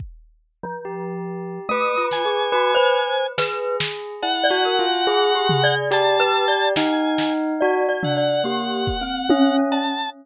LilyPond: <<
  \new Staff \with { instrumentName = "Drawbar Organ" } { \time 4/4 \tempo 4 = 71 r2 dis'''8 gis''4. | r4 fis''2 a''4 | gis''8. r8. fis''2 a''8 | }
  \new Staff \with { instrumentName = "Glockenspiel" } { \time 4/4 r8. f4~ f16 \tuplet 3/2 { a8 f'8 gis'8 } fis'16 c''8. | b'8 r8. d''16 ais'16 r16 \tuplet 3/2 { gis'8 g'8 d''8 d''8 b'8 d''8 } | r4 \tuplet 3/2 { d''8 d''8 d''8 g'4 c'4 cis'4 } | }
  \new Staff \with { instrumentName = "Tubular Bells" } { \time 4/4 r4 g'4 b'4 b'16 b'16 r8 | gis'4 \tuplet 3/2 { e'8 fis'8 f'8 } gis'4 g'4 | dis'4 fis'16 r16 d'16 r16 ais8 r8 cis'8 r8 | }
  \new DrumStaff \with { instrumentName = "Drums" } \drummode { \time 4/4 bd4 r4 r8 sn8 r4 | sn8 sn8 cb4 r8 tomfh8 hh4 | sn8 sn8 r8 tomfh8 r8 bd8 tommh8 cb8 | }
>>